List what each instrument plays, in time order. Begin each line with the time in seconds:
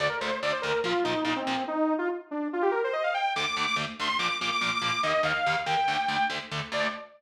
0.00 overdriven guitar D2 D3 A3, lead 2 (sawtooth) D5
0.09 lead 2 (sawtooth) A#4
0.21 overdriven guitar D2 D3 A3, lead 2 (sawtooth) C5
0.42 overdriven guitar D2 D3 A3, lead 2 (sawtooth) D5
0.52 lead 2 (sawtooth) C5
0.62 overdriven guitar D2 D3 A3, lead 2 (sawtooth) A#4
0.84 overdriven guitar A#2 F3 A#3, lead 2 (sawtooth) F4
1.04 overdriven guitar A#2 F3 A#3, lead 2 (sawtooth) D#4
1.24 overdriven guitar A#2 F3 A#3, lead 2 (sawtooth) D#4
1.36 lead 2 (sawtooth) C4
1.47 overdriven guitar A#2 F3 A#3
1.68 lead 2 (sawtooth) D#4
1.98 lead 2 (sawtooth) F4
2.31 lead 2 (sawtooth) D4
2.53 lead 2 (sawtooth) F4
2.62 lead 2 (sawtooth) G4
2.71 lead 2 (sawtooth) A#4
2.84 lead 2 (sawtooth) C5
2.93 lead 2 (sawtooth) D#5
3.03 lead 2 (sawtooth) F5
3.14 lead 2 (sawtooth) G5
3.36 overdriven guitar D2 D3 A3, lead 2 (sawtooth) D6
3.57 overdriven guitar D2 D3 A3
3.67 lead 2 (sawtooth) D6
3.76 overdriven guitar D2 D3 A3
3.99 overdriven guitar D2 D3 A3, lead 2 (sawtooth) C6
4.19 overdriven guitar A#2 F3 A#3, lead 2 (sawtooth) D6
4.28 lead 2 (sawtooth) D6
4.41 overdriven guitar A#2 F3 A#3, lead 2 (sawtooth) D6
4.52 lead 2 (sawtooth) D6
4.61 overdriven guitar A#2 F3 A#3, lead 2 (sawtooth) D6
4.74 lead 2 (sawtooth) D6
4.81 overdriven guitar A#2 F3 A#3, lead 2 (sawtooth) D6
5.03 overdriven guitar D#2 D#3 A#3, lead 2 (sawtooth) D#5
5.23 overdriven guitar D#2 D#3 A#3, lead 2 (sawtooth) F5
5.46 overdriven guitar D#2 D#3 A#3
5.66 overdriven guitar D#2 D#3 A#3, lead 2 (sawtooth) G5
5.88 overdriven guitar D2 D3 A3
6.08 overdriven guitar D2 D3 A3
6.29 overdriven guitar D2 D3 A3
6.51 overdriven guitar D2 D3 A3
6.72 overdriven guitar D2 D3 A3, lead 2 (sawtooth) D5